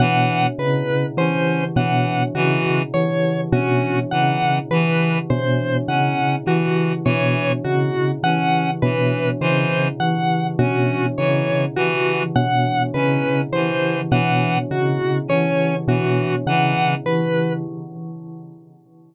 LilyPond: <<
  \new Staff \with { instrumentName = "Tubular Bells" } { \clef bass \time 5/4 \tempo 4 = 51 b,8 cis8 e8 b,8 cis8 e8 b,8 cis8 e8 b,8 | cis8 e8 b,8 cis8 e8 b,8 cis8 e8 b,8 cis8 | e8 b,8 cis8 e8 b,8 cis8 e8 b,8 cis8 e8 | }
  \new Staff \with { instrumentName = "Clarinet" } { \time 5/4 e8 r8 cis'8 e8 e8 r8 cis'8 e8 e8 r8 | cis'8 e8 e8 r8 cis'8 e8 e8 r8 cis'8 e8 | e8 r8 cis'8 e8 e8 r8 cis'8 e8 e8 r8 | }
  \new Staff \with { instrumentName = "Lead 1 (square)" } { \time 5/4 fis''8 b'8 c''8 fis''8 fis'8 cis''8 fis'8 fis''8 b'8 c''8 | fis''8 fis'8 cis''8 fis'8 fis''8 b'8 c''8 fis''8 fis'8 cis''8 | fis'8 fis''8 b'8 c''8 fis''8 fis'8 cis''8 fis'8 fis''8 b'8 | }
>>